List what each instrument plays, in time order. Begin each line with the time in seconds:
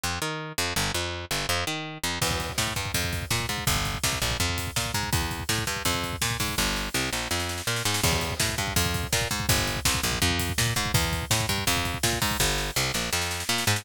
0.03 electric bass (finger) F2
0.22 electric bass (finger) D#3
0.58 electric bass (finger) F2
0.76 electric bass (finger) G1
0.94 electric bass (finger) F2
1.31 electric bass (finger) G1
1.49 electric bass (finger) F2
1.67 electric bass (finger) D#3
2.03 electric bass (finger) F2
2.21 electric bass (finger) E2, kick, crash
2.31 kick
2.40 kick, closed hi-hat
2.49 kick
2.58 electric bass (finger) A2, kick, snare
2.67 kick
2.76 electric bass (finger) G2, kick, closed hi-hat
2.85 kick
2.94 electric bass (finger) F2, kick, closed hi-hat
3.04 kick
3.13 kick, closed hi-hat
3.22 kick
3.30 electric bass (finger) A#2, kick, snare
3.40 kick
3.49 electric bass (finger) G#2, kick, closed hi-hat
3.58 kick
3.67 electric bass (finger) G1, kick, closed hi-hat
3.76 kick
3.85 kick, closed hi-hat
3.95 kick
4.03 electric bass (finger) C2, kick, snare
4.13 kick
4.22 electric bass (finger) A#1, kick, closed hi-hat
4.31 kick
4.40 electric bass (finger) F2, kick
4.49 kick
4.58 kick, closed hi-hat
4.67 kick
4.76 electric bass (finger) A#2, kick, snare
4.86 kick
4.94 electric bass (finger) G#2, kick, closed hi-hat
5.03 kick
5.12 electric bass (finger) E2, kick, closed hi-hat
5.22 kick
5.31 kick, closed hi-hat
5.40 kick
5.49 electric bass (finger) A2, kick, snare
5.58 kick
5.67 electric bass (finger) G2, kick, closed hi-hat
5.76 kick
5.85 electric bass (finger) F2, kick, closed hi-hat
5.94 kick
6.03 kick, closed hi-hat
6.13 kick
6.21 electric bass (finger) A#2, kick, snare
6.31 kick
6.40 electric bass (finger) G#2, kick, open hi-hat
6.49 kick
6.58 electric bass (finger) G1, kick, snare
6.76 snare
6.94 electric bass (finger) C2, snare
7.13 electric bass (finger) A#1, snare
7.31 electric bass (finger) F2, snare
7.39 snare
7.49 snare
7.58 snare
7.67 electric bass (finger) A#2, snare
7.76 snare
7.85 electric bass (finger) G#2, snare
7.94 snare
8.03 electric bass (finger) E2, kick, crash
8.12 kick
8.21 kick, closed hi-hat
8.30 kick
8.40 electric bass (finger) A2, kick, snare
8.49 kick
8.58 electric bass (finger) G2, kick, closed hi-hat
8.67 kick
8.76 electric bass (finger) F2, kick, closed hi-hat
8.85 kick
8.94 kick, closed hi-hat
9.03 kick
9.12 electric bass (finger) A#2, kick, snare
9.21 kick
9.31 electric bass (finger) G#2, kick, closed hi-hat
9.40 kick
9.49 electric bass (finger) G1, kick, closed hi-hat
9.58 kick
9.67 kick, closed hi-hat
9.76 kick
9.85 electric bass (finger) C2, kick, snare
9.94 kick
10.03 electric bass (finger) A#1, kick, closed hi-hat
10.12 kick
10.22 electric bass (finger) F2, kick
10.30 kick
10.39 kick, closed hi-hat
10.49 kick
10.58 electric bass (finger) A#2, kick, snare
10.67 kick
10.76 electric bass (finger) G#2, kick, closed hi-hat
10.86 kick
10.94 electric bass (finger) E2, kick, closed hi-hat
11.04 kick
11.13 kick, closed hi-hat
11.22 kick
11.30 electric bass (finger) A2, kick, snare
11.40 kick
11.49 electric bass (finger) G2, kick, closed hi-hat
11.58 kick
11.67 electric bass (finger) F2, kick, closed hi-hat
11.77 kick
11.85 kick, closed hi-hat
11.94 kick
12.03 electric bass (finger) A#2, kick, snare
12.13 kick
12.22 electric bass (finger) G#2, kick, open hi-hat
12.31 kick
12.40 electric bass (finger) G1, kick, snare
12.58 snare
12.76 electric bass (finger) C2, snare
12.94 electric bass (finger) A#1, snare
13.13 electric bass (finger) F2, snare
13.21 snare
13.31 snare
13.40 snare
13.49 electric bass (finger) A#2, snare
13.58 snare
13.67 electric bass (finger) G#2, snare
13.76 snare